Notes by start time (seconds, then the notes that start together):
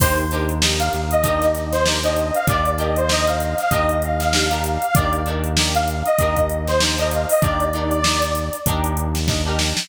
0.00 D#2 D4 D#4 G4 A#4 C5, kick, crash
0.18 closed hi-hat
0.31 D4 D#4 G4 A#4, closed hi-hat
0.49 closed hi-hat
0.62 D4 D#4 G4 A#4, snare
0.79 F5, closed hi-hat
0.93 D#2, snare, closed hi-hat
1.11 D#5, closed hi-hat
1.23 D4 D#4 G4 A#4, kick, closed hi-hat
1.42 snare, closed hi-hat
1.55 snare, closed hi-hat
1.72 C5, snare, closed hi-hat
1.86 D4 D#4 G4 A#4, snare
2.03 D4 D#4 G4 A#4 D#5, snare, closed hi-hat
2.16 D#5, closed hi-hat
2.34 F5, closed hi-hat
2.47 D#2 D4 D#4 G4 A#4 D5, kick, closed hi-hat
2.65 closed hi-hat
2.78 D4 D#4 G4 A#4 D#5, closed hi-hat
2.96 C5, closed hi-hat
3.09 D4 D#4 G4 A#4 D#5, snare
3.27 F5, closed hi-hat
3.40 closed hi-hat
3.58 F5, snare, closed hi-hat
3.70 D#2 D4 D#4 G4 D#5, kick, closed hi-hat
3.74 A#4
3.89 closed hi-hat
4.02 F5, closed hi-hat
4.20 snare, closed hi-hat
4.33 D4 D#4 G4 A#4, snare
4.50 D4 D#4 G4 A#4, closed hi-hat
4.64 closed hi-hat
4.82 closed hi-hat
4.95 D#2 D4 D#4 G4 A#4 D5, kick, closed hi-hat
5.13 closed hi-hat
5.26 D4 D#4 G4 A#4, closed hi-hat
5.44 closed hi-hat
5.57 D4 D#4 G4 A#4, snare
5.75 F5, closed hi-hat
5.88 closed hi-hat
6.05 D#5, closed hi-hat
6.19 D#2 D4 D#4 G4 A#4, kick, closed hi-hat
6.36 kick, closed hi-hat
6.49 closed hi-hat
6.67 C5, snare, closed hi-hat
6.80 D4 D#4 G4 A#4, snare
6.98 D4 D#4 G4 A#4 D#5, closed hi-hat
7.11 F5, closed hi-hat
7.29 D#5, open hi-hat
7.41 D#2 D4 D#4 G4 A#4 D5, kick, closed hi-hat
7.60 closed hi-hat
7.73 D4 D#4 G4 A#4, closed hi-hat
7.91 closed hi-hat
8.04 D4 D#4 G4 A#4, snare
8.22 snare, closed hi-hat
8.35 closed hi-hat
8.53 closed hi-hat
8.66 D#2 D4 D#4 G4 A#4, kick, closed hi-hat
8.84 closed hi-hat
8.97 closed hi-hat
9.15 snare, closed hi-hat
9.28 D4 D#4 G4 A#4, kick, snare
9.45 D4 D#4 G4 A#4
9.59 snare
9.77 snare